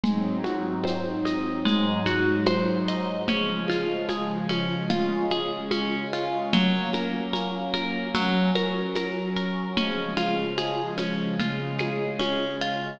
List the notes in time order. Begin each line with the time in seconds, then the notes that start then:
0.04 G#2 F#3 G#3 C4 D#4, low conga, shaker
0.44 F#4, high conga, shaker
0.84 C5, high conga, shaker
1.25 D#5, high conga, shaker
1.65 G#2 F#3 G#3 D#4, low conga, shaker
2.05 F#4, high conga, shaker
2.46 C5, high conga, shaker
2.88 D#5, shaker
3.28 C#3 F3 G#3 C#4, low conga, shaker
3.68 F4, high conga, shaker
4.09 G#4, high conga, shaker
4.49 C#4, high conga, shaker
4.90 C#3 G#3 C#4 F4, low conga, shaker
5.30 G#4, high conga, shaker
5.71 C#4, high conga, shaker
6.13 F4, shaker
6.53 F#3 A#3 C#4, low conga, shaker
6.93 A#4, high conga, shaker
7.33 A#4, high conga, shaker
7.74 A#4, high conga, shaker
8.15 F#3 C#4 F#4, low conga, shaker
8.55 A#4, high conga, shaker
8.95 A#4, high conga, shaker
9.36 A#4, shaker
9.77 C#3 F3 G#3 C#4, low conga, shaker
10.17 F4, high conga, shaker
10.57 G#4, high conga, shaker
10.98 C#4, high conga, shaker
11.39 C#3 G#3 C#4 F4, low conga, shaker
11.78 G#4, high conga, shaker
12.19 C#4, high conga, shaker
12.61 F4, shaker